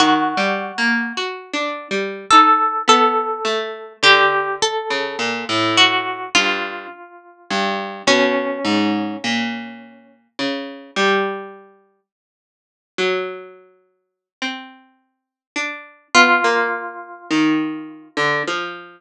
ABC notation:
X:1
M:7/8
L:1/16
Q:1/4=52
K:none
V:1 name="Orchestral Harp"
^F8 A2 A4 | G2 A4 ^F2 =F6 | ^C8 z6 | z14 |
F8 z6 |]
V:2 name="Pizzicato Strings"
(3^D,2 G,2 ^A,2 (3^F2 =D2 G,2 ^D2 B,2 =A,2 | D,3 ^C, ^A,, =A,,3 G,,2 z2 G,,2 | B,,2 ^G,,2 ^A,,4 ^C,2 =G,4 | z3 ^F,5 C4 D2 |
B, ^A,3 ^D,3 =D, F,6 |]